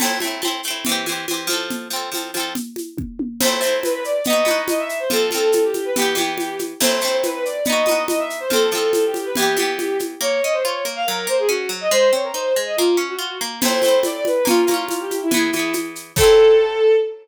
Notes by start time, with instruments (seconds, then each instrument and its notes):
0.00 pizzicato strings A3 C4, crash, low conga, shaker
0.05 pizzicato strings E4
0.20 pizzicato strings A3 C4, high conga, shaker
0.27 pizzicato strings E4
0.42 pizzicato strings A3 C4, high conga, shaker
0.48 pizzicato strings E4
0.63 pizzicato strings A3, shaker
0.68 pizzicato strings C4 E4
0.85 pizzicato strings E3, low conga, shaker
0.89 pizzicato strings C4 G4
1.06 pizzicato strings E3 C4, high conga, shaker
1.12 pizzicato strings G4
1.28 pizzicato strings E3 C4, high conga, shaker
1.34 pizzicato strings G4
1.47 pizzicato strings F3 C4, high conga, shaker
1.53 pizzicato strings A4
1.70 low conga, shaker
1.90 pizzicato strings F3 C4, shaker
1.96 pizzicato strings A4
2.12 pizzicato strings F3 C4, high conga, shaker
2.17 pizzicato strings A4
2.34 pizzicato strings F3 C4, high conga, shaker
2.40 pizzicato strings A4
2.55 low conga, shaker
2.76 high conga, shaker
2.98 kick, high tom
3.19 high tom
3.41 pizzicato strings A3, violin C5, crash, low conga, shaker
3.45 pizzicato strings C4 E4
3.61 pizzicato strings A3 C4, shaker
3.66 pizzicato strings E4
3.83 violin B4, high conga, shaker
3.93 violin B4
4.04 violin D5, shaker
4.24 pizzicato strings B3, violin D#5, low conga, shaker
4.30 pizzicato strings D#4 F#4
4.45 pizzicato strings B3 D#4, high conga, shaker
4.51 pizzicato strings F#4
4.68 violin D#5, high conga, shaker
4.79 violin E5
4.89 shaker
5.00 violin C5
5.10 pizzicato strings F3 C4, violin A4, low conga, shaker
5.16 pizzicato strings A4
5.31 pizzicato strings F3 C4, high conga, shaker
5.37 pizzicato strings A4
5.52 violin A4, high conga, shaker
5.64 violin G4
5.74 high conga, shaker
5.85 violin B4
5.96 pizzicato strings E3 B3, violin G4, low conga, shaker
6.02 pizzicato strings G4
6.15 pizzicato strings E3 B3, high conga, shaker
6.21 pizzicato strings G4
6.38 violin G4, high conga, shaker
6.59 high conga, shaker
6.80 pizzicato strings A3 C4, violin C5, crash, low conga, shaker
6.86 pizzicato strings E4
7.01 pizzicato strings A3 C4, shaker
7.08 pizzicato strings E4
7.23 violin B4, high conga, shaker
7.34 violin B4
7.45 violin D5, shaker
7.65 pizzicato strings B3, violin D#5, low conga, shaker
7.70 pizzicato strings D#4 F#4
7.86 pizzicato strings B3 D#4, high conga, shaker
7.91 pizzicato strings F#4
8.08 violin D#5, high conga, shaker
8.19 violin E5
8.30 shaker
8.40 violin C5
8.50 pizzicato strings F3 C4, violin A4, low conga, shaker
8.56 pizzicato strings A4
8.71 pizzicato strings F3 C4, high conga, shaker
8.78 pizzicato strings A4
8.93 violin A4, high conga, shaker
9.05 violin G4
9.14 high conga, shaker
9.25 violin B4
9.35 pizzicato strings E3, violin G4, low conga, shaker
9.40 pizzicato strings B3 G4
9.57 pizzicato strings E3 B3, high conga, shaker
9.62 pizzicato strings G4
9.79 violin G4, high conga, shaker
9.99 high conga, shaker
10.21 pizzicato strings A#3, violin C#5
10.42 pizzicato strings C#4, violin D#5
10.53 violin C5
10.64 pizzicato strings F4, violin C#5
10.85 pizzicato strings A#3
10.96 violin F5
11.07 pizzicato strings F#3, violin A#4
11.27 pizzicato strings A#3, violin C5
11.38 violin G#4
11.49 pizzicato strings C#4, violin F#4
11.69 pizzicato strings F#3
11.81 violin D#5
11.91 pizzicato strings G#3, violin C5
12.13 pizzicato strings C4, violin C#5
12.24 violin A#4
12.34 pizzicato strings D#4, violin C5
12.56 pizzicato strings G#3
12.66 violin D#5
12.77 pizzicato strings A#3, violin F4
12.97 pizzicato strings C#4
13.09 violin F#4
13.19 pizzicato strings F4
13.41 pizzicato strings A#3
13.61 pizzicato strings A3 C4, violin C5, crash, low conga, shaker
13.68 pizzicato strings E4
13.82 pizzicato strings A3 C4, high conga, shaker
13.88 pizzicato strings E4
14.03 violin D5, high conga, shaker
14.15 violin D5
14.25 violin B4, high conga, shaker
14.45 pizzicato strings A#3 C#4, violin F4, low conga, shaker
14.51 pizzicato strings F4
14.67 pizzicato strings A#3 C#4, high conga, shaker
14.74 pizzicato strings F4
14.89 violin F4, high conga, shaker
15.00 violin G4
15.11 high conga, shaker
15.21 violin E4
15.31 pizzicato strings E3 B3, violin E4, low conga, shaker
15.37 pizzicato strings G#4
15.53 pizzicato strings E3 B3, high conga, shaker
15.59 pizzicato strings G#4
15.73 high conga, shaker
15.95 shaker
16.16 pizzicato strings A3, violin A4, kick, crash
16.20 pizzicato strings C4 E4